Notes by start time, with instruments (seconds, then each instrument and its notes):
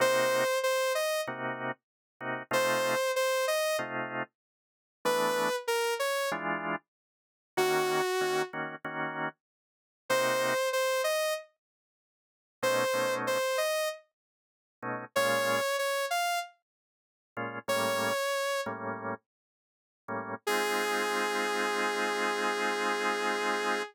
0.00 drawbar organ C3 A#3 D#4 F#4, lead 2 (sawtooth) C5
0.63 lead 2 (sawtooth) C5
0.95 lead 2 (sawtooth) D#5
1.27 drawbar organ C3 A#3 D#4 F#4
2.21 drawbar organ C3 A#3 D#4 F#4
2.51 drawbar organ C3 A3 D#4 F4, lead 2 (sawtooth) C5
3.16 lead 2 (sawtooth) C5
3.48 lead 2 (sawtooth) D#5
3.79 drawbar organ C3 A3 D#4 F4
5.05 drawbar organ E3 A3 B3 D4, lead 2 (sawtooth) B4
5.68 lead 2 (sawtooth) A#4
5.99 lead 2 (sawtooth) C#5
6.32 drawbar organ E3 G#3 D4 F4
7.57 drawbar organ D#3 A#3 C#4 F#4, lead 2 (sawtooth) F#4
8.21 drawbar organ D#3 A#3 C#4 F#4
8.53 drawbar organ D#3 A#3 C#4 F#4
8.84 drawbar organ D#3 A#3 C#4 F#4
10.09 drawbar organ C3 A#3 D#4 F#4, lead 2 (sawtooth) C5
10.73 lead 2 (sawtooth) C5
11.04 lead 2 (sawtooth) D#5
12.63 drawbar organ B2 A3 C#4 D#4, lead 2 (sawtooth) C5
12.94 drawbar organ B2 A3 C#4 D#4
13.27 lead 2 (sawtooth) C5
13.58 lead 2 (sawtooth) D#5
14.83 drawbar organ B2 A3 C#4 D#4
15.16 drawbar organ A#2 G#3 C#4 F4, lead 2 (sawtooth) C#5
15.79 lead 2 (sawtooth) C#5
16.10 lead 2 (sawtooth) F5
17.37 drawbar organ A#2 G#3 C#4 F4
17.68 drawbar organ A2 G3 A#3 C#4, lead 2 (sawtooth) C#5
18.66 drawbar organ A2 G3 A#3 C#4
20.08 drawbar organ A2 G3 A#3 C#4
20.47 drawbar organ G#3 C4 D#4 F4, lead 2 (sawtooth) G#4